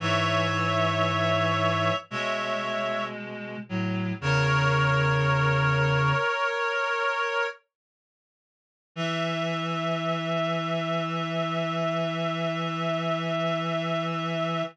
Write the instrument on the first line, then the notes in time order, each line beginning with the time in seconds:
clarinet
0.00 G#2 E3 C#5 E5
2.11 B2 G#3 C#5 E5
3.69 A2 F#3
4.21 E2 C#3 A#4 C#5
8.96 E3 E5